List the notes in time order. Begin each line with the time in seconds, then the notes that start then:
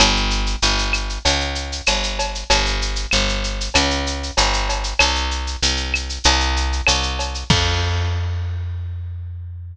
0.00 G1, cowbell, claves, shaker
0.16 shaker
0.30 shaker
0.46 shaker
0.62 G1, shaker
0.78 shaker
0.93 claves, shaker
1.09 shaker
1.25 C#2, cowbell, shaker
1.40 shaker
1.55 shaker
1.72 shaker
1.86 G1, cowbell, claves, shaker
2.03 shaker
2.19 cowbell, shaker
2.35 shaker
2.50 G1, cowbell, shaker
2.66 shaker
2.82 shaker
2.96 shaker
3.11 G1, claves, shaker
3.29 shaker
3.44 shaker
3.61 shaker
3.74 C#2, cowbell, claves, shaker
3.90 shaker
4.07 shaker
4.23 shaker
4.37 G1, cowbell, shaker
4.54 shaker
4.69 cowbell, shaker
4.84 shaker
4.99 C2, cowbell, claves, shaker
5.15 shaker
5.31 shaker
5.47 shaker
5.62 C2, shaker
5.77 shaker
5.94 claves, shaker
6.09 shaker
6.24 C2, cowbell, shaker
6.40 shaker
6.57 shaker
6.73 shaker
6.87 C2, cowbell, claves, shaker
7.03 shaker
7.19 cowbell, shaker
7.35 shaker
7.50 F2, kick, crash